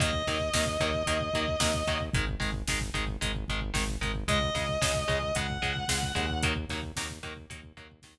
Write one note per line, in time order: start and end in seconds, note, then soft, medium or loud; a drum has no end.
0.00 0.23 D#2 medium
0.00 0.11 D#3 medium
0.00 0.11 F#3 medium
0.00 0.11 A#3 medium
0.00 1.99 D#5 medium
0.00 kick loud
0.00 closed hi-hat loud
0.13 kick medium
0.27 0.50 D#2 medium
0.27 0.38 D#3 medium
0.27 0.38 F#3 medium
0.27 0.38 A#3 medium
0.27 kick medium
0.27 snare medium
0.27 closed hi-hat medium
0.40 kick medium
0.53 0.77 D#2 medium
0.53 0.65 D#3 medium
0.53 0.65 F#3 medium
0.53 0.65 A#3 medium
0.53 kick loud
0.53 snare loud
0.66 kick loud
0.80 1.03 D#2 loud
0.80 0.91 D#3 medium
0.80 0.91 F#3 medium
0.80 0.91 A#3 medium
0.80 kick loud
0.80 closed hi-hat medium
0.94 kick medium
1.06 1.30 D#2 medium
1.06 1.18 D#3 medium
1.06 1.18 F#3 medium
1.06 1.18 A#3 medium
1.06 kick medium
1.06 closed hi-hat loud
1.21 kick loud
1.33 1.56 D#2 medium
1.33 1.46 D#3 medium
1.33 1.46 F#3 medium
1.33 1.46 A#3 medium
1.33 kick medium
1.33 closed hi-hat medium
1.48 kick loud
1.60 1.83 D#2 medium
1.60 1.71 D#3 medium
1.60 1.71 F#3 medium
1.60 1.71 A#3 medium
1.60 kick loud
1.60 snare loud
1.74 kick loud
1.87 2.10 D#2 medium
1.87 1.98 D#3 medium
1.87 1.98 F#3 medium
1.87 1.98 A#3 medium
1.87 kick medium
1.87 closed hi-hat medium
2.00 kick loud
2.14 2.36 G#1 loud
2.14 2.25 D#3 medium
2.14 2.25 G#3 medium
2.14 kick loud
2.14 closed hi-hat loud
2.28 kick loud
2.40 2.64 G#1 medium
2.40 2.50 D#3 medium
2.40 2.50 G#3 medium
2.40 kick loud
2.40 snare medium
2.40 closed hi-hat medium
2.53 kick loud
2.67 2.90 G#1 medium
2.67 2.79 D#3 medium
2.67 2.79 G#3 medium
2.67 kick loud
2.67 snare loud
2.81 kick loud
2.94 3.17 G#1 medium
2.94 3.05 D#3 medium
2.94 3.05 G#3 medium
2.94 kick medium
2.94 closed hi-hat medium
3.08 kick medium
3.21 3.45 G#1 medium
3.21 3.32 D#3 medium
3.21 3.32 G#3 medium
3.21 kick loud
3.21 closed hi-hat loud
3.35 kick medium
3.48 3.72 G#1 loud
3.48 3.60 D#3 medium
3.48 3.60 G#3 medium
3.48 kick medium
3.48 closed hi-hat medium
3.61 kick medium
3.74 3.97 G#1 loud
3.74 3.84 D#3 medium
3.74 3.84 G#3 medium
3.74 kick loud
3.74 snare loud
3.88 kick medium
4.01 4.24 G#1 medium
4.01 4.12 D#3 medium
4.01 4.12 G#3 medium
4.01 kick loud
4.01 closed hi-hat medium
4.15 kick medium
4.28 4.51 C#2 loud
4.28 4.39 C#3 medium
4.28 4.39 G#3 loud
4.28 5.35 D#5 medium
4.28 kick loud
4.28 closed hi-hat loud
4.42 kick loud
4.55 4.78 C#2 medium
4.55 4.66 C#3 medium
4.55 4.66 G#3 medium
4.55 kick loud
4.55 snare medium
4.55 closed hi-hat medium
4.69 kick medium
4.81 5.05 C#2 medium
4.81 4.92 C#3 medium
4.81 4.92 G#3 medium
4.81 kick loud
4.81 snare loud
4.95 kick loud
5.08 5.32 C#2 medium
5.08 5.19 C#3 medium
5.08 5.19 G#3 medium
5.08 kick loud
5.08 closed hi-hat medium
5.23 kick medium
5.35 5.58 C#2 medium
5.35 5.47 C#3 medium
5.35 5.47 G#3 medium
5.35 6.40 F#5 medium
5.35 kick loud
5.35 closed hi-hat loud
5.50 kick loud
5.62 5.85 C#2 medium
5.62 5.73 C#3 medium
5.62 5.73 G#3 medium
5.62 kick loud
5.62 closed hi-hat medium
5.76 kick medium
5.88 6.12 C#2 medium
5.88 5.99 C#3 medium
5.88 5.99 G#3 medium
5.88 kick loud
5.88 snare loud
6.03 kick loud
6.15 6.66 D#2 loud
6.15 6.26 C#3 medium
6.15 6.26 G#3 medium
6.15 kick medium
6.15 closed hi-hat medium
6.30 kick medium
6.43 6.54 D#3 medium
6.43 6.54 F#3 medium
6.43 6.54 A#3 medium
6.43 kick loud
6.43 closed hi-hat loud
6.56 kick loud
6.69 6.92 D#2 loud
6.69 6.81 D#3 medium
6.69 6.81 F#3 medium
6.69 6.81 A#3 medium
6.69 kick medium
6.69 snare medium
6.69 closed hi-hat medium
6.83 kick medium
6.96 7.20 D#2 loud
6.96 7.08 D#3 medium
6.96 7.08 F#3 medium
6.96 7.08 A#3 medium
6.96 kick loud
6.96 snare loud
7.10 kick medium
7.23 7.47 D#2 medium
7.23 7.34 D#3 medium
7.23 7.34 F#3 medium
7.23 7.34 A#3 medium
7.23 kick medium
7.23 closed hi-hat medium
7.37 kick medium
7.50 7.72 D#2 medium
7.50 7.61 D#3 medium
7.50 7.61 F#3 medium
7.50 7.61 A#3 medium
7.50 kick loud
7.50 closed hi-hat loud
7.63 kick loud
7.77 8.00 D#2 medium
7.77 7.88 D#3 medium
7.77 7.88 F#3 medium
7.77 7.88 A#3 medium
7.77 kick medium
7.77 closed hi-hat medium
7.92 kick loud
8.02 8.18 D#2 loud
8.02 8.15 D#3 medium
8.02 8.15 F#3 medium
8.02 8.15 A#3 medium
8.02 kick loud
8.02 snare loud
8.18 kick loud